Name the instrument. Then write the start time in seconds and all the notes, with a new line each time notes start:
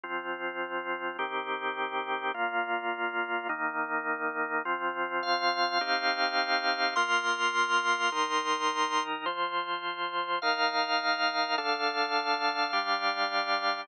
drawbar organ
0.03 F3 C4 F4
1.19 D#3 C4 G4
2.34 A#2 A#3 F4
3.49 D#3 A#3 D#4
4.65 F3 C4 F4
5.23 F5
5.81 C4 D#4 G4
6.96 A#3 F4 A#4 C6
8.12 D#3 D#4 A#4
9.26 F3 F4 C5
10.42 D#3 D#4 A#4 F5
11.58 D3 D4 A4 F5
12.73 G3 D4 G4